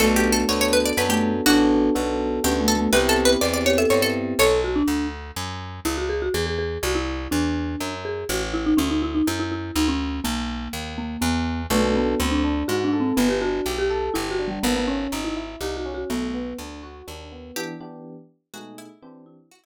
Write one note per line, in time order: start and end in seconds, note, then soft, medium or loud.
0.00 0.45 B1 medium
0.00 0.87 A3 medium
0.00 0.44 B3 medium
0.00 0.44 D4 medium
0.00 0.44 F#4 medium
0.00 0.15 A4 medium
0.00 0.44 A4 medium
0.16 0.32 G4 medium
0.32 0.48 A4 medium
0.49 0.93 D2 medium
0.49 0.93 B3 medium
0.49 0.93 D4 medium
0.49 0.93 F#4 medium
0.49 0.93 A4 medium
0.49 0.60 C#5 medium
0.61 0.73 C#5 medium
0.73 0.85 B4 medium
0.85 0.97 D5 medium
0.97 1.41 F#2 medium
0.97 1.41 B3 medium
0.97 1.41 D4 medium
0.97 1.41 F#4 medium
0.97 1.41 A4 medium
0.97 1.09 B4 medium
1.09 1.32 A3 medium
1.09 1.46 G4 medium
1.46 1.90 A1 medium
1.46 1.90 B3 medium
1.46 2.32 D4 medium
1.46 1.90 D4 medium
1.46 1.66 F#4 medium
1.46 1.90 F#4 loud
1.46 1.90 A4 medium
1.95 2.40 B1 medium
1.95 2.39 B3 medium
1.95 2.39 D4 medium
1.95 2.39 F#4 medium
1.95 2.39 A4 medium
2.44 2.88 D2 medium
2.44 2.88 B3 medium
2.44 2.60 C#4 medium
2.44 2.88 D4 medium
2.44 2.88 F#4 medium
2.44 2.65 G4 medium
2.44 2.88 A4 medium
2.60 2.76 A3 medium
2.68 2.89 A4 medium
2.77 2.92 A3 medium
2.93 3.36 C2 loud
2.93 3.36 B3 medium
2.93 3.36 C4 medium
2.93 3.36 E4 medium
2.93 3.36 G4 loud
2.93 3.53 G4 medium
2.93 3.08 B4 medium
3.09 3.24 A4 medium
3.25 3.41 B4 medium
3.41 3.86 E2 medium
3.41 3.85 B3 medium
3.41 3.85 C4 medium
3.41 3.85 E4 medium
3.41 3.85 G4 medium
3.41 3.53 D5 medium
3.54 3.65 D5 medium
3.66 3.78 G4 medium
3.66 3.78 C#5 medium
3.78 4.00 A4 medium
3.78 3.90 E5 medium
3.90 4.34 G2 medium
3.90 4.34 B3 medium
3.90 4.34 C4 medium
3.90 4.34 E4 medium
3.90 4.34 G4 medium
3.90 4.02 C#5 medium
4.02 4.32 A4 medium
4.39 4.83 B1 loud
4.39 4.61 A4 medium
4.39 4.87 C#5 medium
4.64 4.76 F#4 medium
4.76 5.07 D4 medium
4.88 5.32 D2 medium
5.36 5.80 F#2 medium
5.85 6.29 C#2 medium
5.85 5.97 E4 medium
5.98 6.09 F#4 medium
6.09 6.21 G#4 medium
6.22 6.34 F#4 medium
6.34 6.78 E2 medium
6.34 6.46 G#4 medium
6.46 6.58 G#4 medium
6.59 6.79 G#4 medium
6.83 7.28 C2 loud
6.83 6.95 F#4 medium
6.95 7.30 E4 medium
7.31 7.76 E2 medium
7.31 7.92 D4 medium
7.80 8.24 F#2 medium
8.05 8.27 G#4 medium
8.29 8.74 A1 loud
8.29 8.41 F#4 medium
8.54 8.65 E4 medium
8.66 8.78 D#4 medium
8.77 9.22 D2 medium
8.77 8.89 C#4 medium
8.90 9.02 D#4 medium
9.02 9.14 E4 medium
9.15 9.26 D#4 medium
9.27 9.71 F#2 loud
9.27 9.39 E4 medium
9.40 9.51 E4 medium
9.52 9.75 E4 medium
9.76 10.20 D2 loud
9.76 9.88 D#4 medium
9.88 10.19 C#4 medium
10.24 10.68 B1 loud
10.24 10.91 A#3 medium
10.73 11.17 D#2 medium
10.98 11.22 A#3 medium
11.21 11.67 E2 loud
11.21 11.62 B3 medium
11.70 12.15 B1 loud
11.70 11.82 A3 medium
11.70 12.15 B3 medium
11.70 12.15 D4 medium
11.70 12.15 F#4 medium
11.70 12.15 A4 medium
11.83 11.94 A3 medium
11.95 12.26 B3 medium
12.20 12.64 D2 loud
12.20 12.41 C4 medium
12.31 12.66 D4 medium
12.44 12.66 D4 medium
12.68 13.13 G#2 medium
12.68 12.83 F#4 medium
12.68 12.90 F#4 medium
12.84 13.00 D4 medium
12.93 13.15 A4 medium
13.00 13.16 C4 medium
13.17 13.61 G1 medium
13.17 13.28 B3 medium
13.17 13.39 B3 medium
13.29 13.40 G4 medium
13.41 13.63 D4 medium
13.41 13.75 F#4 medium
13.66 14.10 B1 medium
13.66 13.88 G4 medium
13.78 14.11 G4 medium
13.90 14.12 A4 medium
14.14 14.59 G1 medium
14.14 14.29 E4 medium
14.14 14.36 G4 medium
14.31 14.46 F#4 medium
14.39 14.61 D4 medium
14.48 14.63 G3 medium
14.63 15.07 G#1 loud
14.63 14.75 B3 medium
14.63 14.85 B3 loud
14.76 14.88 B3 medium
14.87 15.19 C#4 medium
14.87 15.10 C#4 medium
15.12 15.56 G#1 medium
15.12 15.34 D#4 medium
15.24 15.60 E4 medium
15.37 15.59 E4 medium
15.61 16.04 C2 medium
15.61 15.83 D#4 medium
15.61 15.76 G4 medium
15.77 15.92 F#4 medium
15.85 16.07 C#4 medium
15.94 16.10 F#4 medium
16.10 16.54 B1 medium
16.10 16.32 A3 medium
16.10 16.57 B3 medium
16.34 16.56 B3 medium
16.58 17.02 D2 medium
16.58 16.81 D4 medium
16.83 17.05 F#4 medium
17.07 17.52 D#2 medium
17.07 17.29 D4 medium
17.32 17.54 B3 medium
17.56 17.73 E3 loud
17.56 17.73 B3 loud
17.56 17.73 D4 loud
17.56 18.02 E4 medium
17.56 17.73 G4 loud
17.56 17.77 G4 loud
17.80 18.15 E3 medium
17.80 18.15 B3 medium
17.80 18.15 D4 medium
17.80 18.15 G4 medium
18.54 18.88 B2 loud
18.54 18.77 G#3 medium
18.54 18.88 A3 medium
18.54 18.88 D#4 loud
18.54 18.77 F#4 medium
18.54 18.88 G#4 loud
18.78 19.01 E4 medium
19.02 19.37 E3 loud
19.02 19.23 C4 medium
19.02 19.37 C4 loud
19.02 19.37 D4 medium
19.02 19.37 G4 medium
19.26 19.65 E4 medium
19.51 19.63 F#4 medium
19.64 19.65 E4 medium